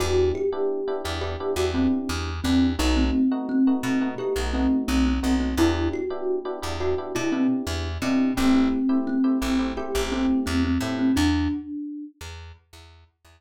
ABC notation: X:1
M:4/4
L:1/16
Q:1/4=86
K:Em
V:1 name="Kalimba"
F2 G4 z G2 F C2 z2 C2 | ^D C3 C4 G2 C2 C C2 C | E2 F4 z F2 E C2 z2 C2 | C C3 C4 G2 C2 C C2 C |
D6 z10 |]
V:2 name="Electric Piano 1"
[B,DEG]3 [B,DEG]2 [B,DEG] [B,DEG] [B,DEG] [B,DEG] [B,DEG] [B,DEG]4 [B,DEG]2 | [A,B,^DF]3 [A,B,DF]2 [A,B,DF] [A,B,DF] [A,B,DF] [A,B,DF] [A,B,DF] [A,B,DF]4 [A,B,DF]2 | [B,DEG]3 [B,DEG]2 [B,DEG] [B,DEG] [B,DEG] [B,DEG] [B,DEG] [B,DEG]4 [B,DEG]2 | [A,CEG]3 [A,CEG]2 [A,CEG] [A,CEG] [A,CEG] [A,CEG] [A,CEG] [A,CEG]4 [A,CEG]2 |
z16 |]
V:3 name="Electric Bass (finger)" clef=bass
E,,6 E,,3 E,,3 E,,2 E,,2 | B,,,6 B,,3 B,,,3 B,,,2 B,,,2 | E,,6 E,,3 B,,3 E,,2 B,,2 | A,,,6 A,,,3 A,,,3 E,,2 A,,2 |
E,,6 E,,3 E,,3 E,,2 z2 |]